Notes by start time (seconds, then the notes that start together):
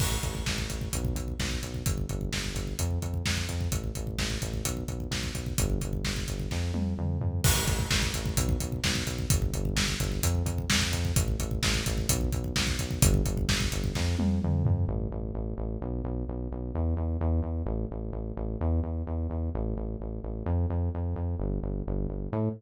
0.00 A1, kick, crash
0.12 kick
0.23 A1, kick, closed hi-hat
0.35 kick
0.46 A1, kick, snare
0.58 kick
0.69 A1, kick, closed hi-hat
0.81 kick
0.93 B1, kick, closed hi-hat
1.05 kick
1.15 B1, kick, closed hi-hat
1.28 kick
1.40 B1, kick, snare
1.51 kick
1.63 B1, kick, closed hi-hat
1.74 kick
1.86 G1, kick, closed hi-hat
1.98 kick
2.09 G1, kick, closed hi-hat
2.21 kick
2.33 G1, kick, snare
2.44 kick
2.55 G1, kick, closed hi-hat
2.67 kick
2.79 F2, kick, closed hi-hat
2.91 kick
3.02 F2, kick, closed hi-hat
3.14 kick
3.26 F2, kick, snare
3.37 kick
3.49 F2, kick, closed hi-hat
3.61 kick
3.71 A1, kick, closed hi-hat
3.84 kick
3.95 A1, kick, closed hi-hat
4.07 kick
4.18 A1, kick, snare
4.30 kick
4.42 A1, kick, closed hi-hat
4.53 kick
4.64 B1, kick, closed hi-hat
4.77 kick
4.88 B1, kick, closed hi-hat
5.00 kick
5.11 B1, kick, snare
5.23 kick
5.34 B1, kick, closed hi-hat
5.46 kick
5.58 G1, kick, closed hi-hat
5.70 kick
5.81 G1, kick, closed hi-hat
5.93 kick
6.04 G1, kick, snare
6.16 kick
6.28 G1, kick, closed hi-hat
6.40 kick
6.51 F2, kick, snare
6.74 F2, high tom
6.98 F2, mid tom
7.21 F2, floor tom
7.44 A1, kick, crash
7.56 kick
7.66 A1, kick, closed hi-hat
7.79 kick
7.91 A1, kick, snare
8.03 kick
8.14 A1, kick, closed hi-hat
8.26 kick
8.37 B1, kick, closed hi-hat
8.49 kick
8.60 B1, kick, closed hi-hat
8.72 kick
8.84 B1, kick, snare
8.95 kick
9.06 B1, kick, closed hi-hat
9.19 kick
9.30 G1, kick, closed hi-hat
9.42 kick
9.53 G1, kick, closed hi-hat
9.65 kick
9.76 G1, kick, snare
9.88 kick
10.00 G1, kick, closed hi-hat
10.12 kick
10.23 F2, kick, closed hi-hat
10.35 kick
10.45 F2, kick, closed hi-hat
10.58 kick
10.70 F2, kick, snare
10.81 kick
10.92 F2, kick, closed hi-hat
11.05 kick
11.16 A1, kick, closed hi-hat
11.28 kick
11.40 A1, kick, closed hi-hat
11.51 kick
11.63 A1, kick, snare
11.74 kick
11.86 A1, kick, closed hi-hat
11.98 kick
12.09 B1, kick, closed hi-hat
12.21 kick
12.32 B1, kick, closed hi-hat
12.44 kick
12.56 B1, kick, snare
12.67 kick
12.79 B1, kick, closed hi-hat
12.91 kick
13.02 G1, kick, closed hi-hat
13.14 kick
13.25 G1, kick, closed hi-hat
13.37 kick
13.49 G1, kick, snare
13.60 kick
13.72 G1, kick, closed hi-hat
13.84 kick
13.95 F2, kick, snare
14.19 F2, high tom
14.42 F2, mid tom
14.65 F2, floor tom
14.88 A1
15.12 A1
15.34 A1
15.58 A1
15.82 B1
16.04 B1
16.28 B1
16.52 B1
16.75 E2
16.97 E2
17.21 E2
17.43 E2
17.66 A1
17.91 A1
18.13 A1
18.37 A1
18.61 E2
18.83 E2
19.07 E2
19.30 E2
19.55 A1
19.76 A1
20.00 A1
20.23 A1
20.46 F2
20.70 F2
20.95 F2
21.16 F2
21.40 G1
21.62 G1
21.87 G1
22.08 G1
22.32 A2